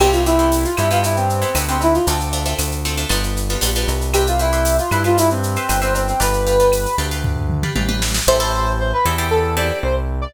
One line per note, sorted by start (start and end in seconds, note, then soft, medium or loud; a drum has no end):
0.00 0.66 C2 medium
0.00 0.20 B3 medium
0.00 0.20 C4 medium
0.00 0.20 E4 medium
0.00 0.12 G4 medium
0.00 0.20 G4 medium
0.00 crash medium
0.00 cowbell medium
0.00 claves medium
0.12 0.24 F4 medium
0.12 shaker medium
0.26 0.37 B3 medium
0.26 0.37 C4 medium
0.26 0.64 E4 medium
0.26 0.37 E4 medium
0.26 0.37 G4 medium
0.26 shaker medium
0.39 0.70 B3 medium
0.39 0.70 C4 medium
0.39 0.70 E4 medium
0.39 0.70 G4 medium
0.39 shaker medium
0.52 tambourine medium
0.52 shaker medium
0.64 0.76 F4 medium
0.64 shaker medium
0.77 1.44 G2 medium
0.77 0.88 B3 medium
0.77 0.88 C4 medium
0.77 0.88 E4 medium
0.77 0.90 E4 medium
0.77 0.88 G4 medium
0.77 claves medium
0.77 shaker medium
0.91 1.32 B3 medium
0.91 1.32 C4 medium
0.91 1.32 E4 medium
0.91 1.03 F4 medium
0.91 1.32 G4 medium
0.91 shaker medium
1.03 1.16 E4 medium
1.03 cowbell medium
1.03 shaker medium
1.16 1.58 C4 medium
1.16 shaker medium
1.30 shaker medium
1.42 1.52 B3 medium
1.42 1.52 C4 medium
1.42 1.52 E4 medium
1.42 1.52 G4 medium
1.42 shaker medium
1.55 1.99 D2 medium
1.55 1.65 B3 medium
1.55 1.65 C4 medium
1.55 1.65 E4 medium
1.55 1.65 G4 medium
1.55 tambourine medium
1.55 cowbell medium
1.55 claves medium
1.55 shaker medium
1.69 2.00 B3 medium
1.69 2.00 C4 medium
1.69 1.81 C4 medium
1.69 2.00 E4 medium
1.69 2.00 G4 medium
1.69 shaker medium
1.81 1.95 E4 medium
1.81 cowbell medium
1.81 shaker medium
1.94 2.06 F4 medium
1.94 shaker medium
2.07 2.54 D2 medium
2.07 2.28 A3 medium
2.07 2.28 C4 medium
2.07 2.28 D4 medium
2.07 2.28 F4 medium
2.07 cowbell medium
2.07 shaker medium
2.20 shaker medium
2.33 2.43 A3 medium
2.33 2.43 C4 medium
2.33 2.43 D4 medium
2.33 2.43 F4 medium
2.33 shaker medium
2.46 2.77 A3 medium
2.46 2.77 C4 medium
2.46 2.77 D4 medium
2.46 2.77 F4 medium
2.46 shaker medium
2.58 3.05 D2 medium
2.58 tambourine medium
2.58 claves medium
2.58 shaker medium
2.72 shaker medium
2.85 2.95 A3 medium
2.85 2.95 C4 medium
2.85 2.95 D4 medium
2.85 2.95 F4 medium
2.85 shaker medium
2.97 3.08 A3 medium
2.97 3.08 C4 medium
2.97 3.08 D4 medium
2.97 3.08 F4 medium
2.97 shaker medium
3.09 3.57 G1 medium
3.09 3.40 G3 medium
3.09 3.40 B3 medium
3.09 3.40 D4 medium
3.09 3.40 F4 medium
3.09 cowbell medium
3.09 claves medium
3.09 shaker medium
3.23 shaker medium
3.37 shaker medium
3.49 3.60 G3 medium
3.49 3.60 B3 medium
3.49 3.60 D4 medium
3.49 3.60 F4 medium
3.49 shaker medium
3.61 3.85 A#1 medium
3.61 3.72 G3 medium
3.61 3.72 B3 medium
3.61 3.72 D4 medium
3.61 3.72 F4 medium
3.61 tambourine medium
3.61 cowbell medium
3.61 shaker medium
3.75 4.07 G3 medium
3.75 4.07 B3 medium
3.75 4.07 D4 medium
3.75 4.07 F4 medium
3.75 shaker medium
3.88 4.80 C2 medium
3.88 cowbell medium
3.88 shaker medium
4.01 shaker medium
4.14 4.26 G4 medium
4.14 4.34 G4 medium
4.14 4.34 B4 medium
4.14 4.34 C5 medium
4.14 4.34 E5 medium
4.14 cowbell medium
4.14 claves medium
4.14 shaker medium
4.27 4.39 F4 medium
4.27 shaker medium
4.39 4.77 E4 medium
4.39 4.50 G4 medium
4.39 4.50 B4 medium
4.39 4.50 C5 medium
4.39 4.50 E5 medium
4.39 shaker medium
4.53 4.84 G4 medium
4.53 4.84 B4 medium
4.53 4.84 C5 medium
4.53 4.84 E5 medium
4.53 shaker medium
4.65 tambourine medium
4.65 shaker medium
4.78 4.91 F4 medium
4.78 shaker medium
4.91 5.57 G2 medium
4.91 5.03 E4 medium
4.91 5.02 G4 medium
4.91 5.02 B4 medium
4.91 5.02 C5 medium
4.91 5.02 E5 medium
4.91 claves medium
4.91 shaker medium
5.04 5.17 F4 medium
5.04 5.46 G4 medium
5.04 5.46 B4 medium
5.04 5.46 C5 medium
5.04 5.46 E5 medium
5.04 shaker medium
5.17 5.29 E4 medium
5.17 cowbell medium
5.17 shaker loud
5.30 5.80 C4 medium
5.30 shaker medium
5.43 shaker medium
5.56 5.67 G4 medium
5.56 5.67 B4 medium
5.56 5.67 C5 medium
5.56 5.67 E5 medium
5.56 shaker medium
5.69 6.13 G1 medium
5.69 5.80 G4 medium
5.69 5.80 B4 medium
5.69 5.80 C5 medium
5.69 5.80 E5 medium
5.69 tambourine medium
5.69 cowbell medium
5.69 claves medium
5.69 shaker medium
5.81 5.93 C4 medium
5.81 6.13 G4 medium
5.81 6.13 B4 medium
5.81 6.13 C5 medium
5.81 6.13 E5 medium
5.81 shaker medium
5.95 6.07 C4 medium
5.95 cowbell medium
5.95 shaker medium
6.08 6.20 C4 medium
6.08 shaker medium
6.20 6.87 G1 medium
6.20 6.41 G4 medium
6.20 6.41 B4 medium
6.20 6.96 B4 medium
6.20 6.41 D5 medium
6.20 6.41 F5 medium
6.20 cowbell medium
6.20 shaker medium
6.33 shaker medium
6.47 6.57 G4 medium
6.47 6.57 B4 medium
6.47 6.57 D5 medium
6.47 6.57 F5 medium
6.47 shaker medium
6.60 6.91 G4 medium
6.60 6.91 B4 medium
6.60 6.91 D5 medium
6.60 6.91 F5 medium
6.60 shaker medium
6.72 tambourine medium
6.72 claves medium
6.72 shaker medium
6.86 shaker medium
6.98 7.64 D2 medium
6.98 7.09 G4 medium
6.98 7.09 B4 medium
6.98 7.09 D5 medium
6.98 7.09 F5 medium
6.98 shaker medium
7.11 7.53 G4 medium
7.11 7.53 B4 medium
7.11 7.53 D5 medium
7.11 7.53 F5 medium
7.11 shaker medium
7.24 kick medium
7.24 floor tom medium
7.37 floor tom medium
7.50 mid tom medium
7.63 7.74 G4 medium
7.63 7.74 B4 medium
7.63 7.74 D5 medium
7.63 7.74 F5 medium
7.63 mid tom medium
7.75 8.20 A1 medium
7.75 7.86 G4 medium
7.75 7.86 B4 medium
7.75 7.86 D5 medium
7.75 7.86 F5 medium
7.75 high tom medium
7.89 8.20 G4 medium
7.89 8.20 B4 medium
7.89 8.20 D5 medium
7.89 8.20 F5 medium
7.89 high tom medium
8.02 snare medium
8.14 snare medium
8.27 8.93 A1 loud
8.27 8.38 C4 loud
8.27 8.38 E4 loud
8.27 8.38 G4 loud
8.27 8.38 A4 medium
8.27 8.72 C5 loud
8.40 8.81 C4 medium
8.40 8.81 E4 medium
8.40 8.81 G4 loud
8.40 8.81 A4 loud
8.79 8.92 C5 medium
8.93 9.05 B4 medium
9.05 9.71 E2 medium
9.05 9.16 C4 medium
9.05 9.16 E4 loud
9.05 9.16 G4 loud
9.05 9.16 A4 medium
9.18 9.49 C4 medium
9.18 9.49 E4 medium
9.18 9.49 G4 medium
9.18 9.49 A4 medium
9.31 9.55 A4 medium
9.57 9.98 C4 loud
9.57 9.98 E4 medium
9.57 9.98 G4 medium
9.57 9.98 A4 medium
9.57 9.79 D5 medium
9.83 10.27 C2 medium
9.83 9.95 C5 medium
10.22 10.34 D5 medium